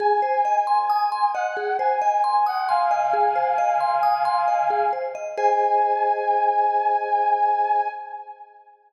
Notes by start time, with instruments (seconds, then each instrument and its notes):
0.00 vibraphone G#4, brass section G#5
0.22 vibraphone C5
0.45 vibraphone D#5
0.67 brass section G#5, vibraphone C6
0.90 vibraphone D#6
1.12 vibraphone C6
1.34 vibraphone D#5, brass section F#5
1.57 vibraphone G#4
1.79 vibraphone C5, brass section G#5
2.01 vibraphone D#5, brass section G#5
2.24 brass section G#5, vibraphone C6
2.46 brass section F#5, vibraphone D#6
2.68 brass section F5 G#5, vibraphone C6
2.91 vibraphone D#5
3.13 vibraphone G#4
3.36 vibraphone C5
3.58 vibraphone D#5
3.80 vibraphone C6
4.03 vibraphone D#6
4.25 vibraphone C6
4.48 vibraphone D#5
4.70 vibraphone G#4
4.93 vibraphone C5
5.15 vibraphone D#5
5.37 vibraphone G#4 C5 D#5, brass section G#5